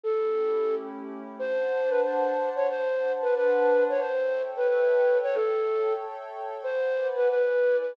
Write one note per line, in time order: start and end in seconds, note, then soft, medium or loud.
0.04 1.37 A3 medium
0.04 1.37 C#4 medium
0.04 1.37 E4 medium
0.04 1.37 G4 medium
0.04 0.75 A4 loud
1.36 2.67 D4 medium
1.36 2.67 C5 medium
1.36 1.90 C5 loud
1.36 2.67 F#5 medium
1.36 2.67 A5 medium
1.89 2.01 B4 loud
2.03 2.50 C5 medium
2.56 2.67 C#5 loud
2.69 4.00 D4 medium
2.69 4.00 C5 medium
2.69 3.12 C5 loud
2.69 4.00 F#5 medium
2.69 4.00 A5 medium
3.22 3.34 B4 loud
3.36 3.83 B4 loud
3.89 4.00 C#5 loud
4.00 5.32 A4 medium
4.00 4.42 C5 loud
4.00 5.32 C#5 medium
4.00 5.32 E5 medium
4.00 5.32 G5 medium
4.57 4.68 B4 loud
4.68 5.18 B4 loud
5.23 5.35 C#5 loud
5.32 6.63 A4 medium
5.32 5.93 A4 loud
5.32 6.63 C#5 medium
5.32 6.63 E5 medium
5.32 6.63 G5 medium
6.64 7.30 B4 medium
6.64 7.07 C5 loud
6.64 7.30 D5 medium
6.64 7.30 F#5 medium
6.64 7.30 G#5 medium
7.16 7.28 B4 loud
7.29 7.96 E4 medium
7.29 7.76 B4 loud
7.29 7.96 B4 medium
7.29 7.96 D5 medium
7.29 7.96 G#5 medium
7.81 7.92 B4 medium